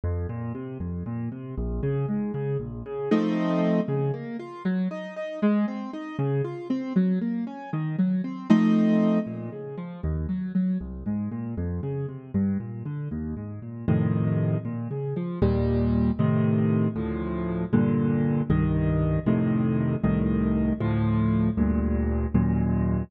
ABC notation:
X:1
M:6/8
L:1/8
Q:3/8=78
K:Bbm
V:1 name="Acoustic Grand Piano"
F,, B,, C, F,, B,, C, | B,,, D, A,, D, B,,, D, | [F,=A,CE]3 D, B, F | G, E E A, C E |
D, F C G, B, D | E, G, C [F,=A,CE]3 | B,, D, F, E,, G, G, | C,, A,, B,, F,, D, C, |
=G,, B,, =D, E,, A,, B,, | [F,,=A,,C,E,]3 B,, D, F, | [K:Bb] [E,,B,,G,]3 [A,,C,E,]3 | [D,,A,,F,]3 [G,,B,,D,]3 |
[C,,G,,E,]3 [F,,A,,C,E,]3 | [C,,A,,E,]3 [D,,A,,F,]3 | [D,,G,,B,,]3 [E,,_G,,B,,]3 |]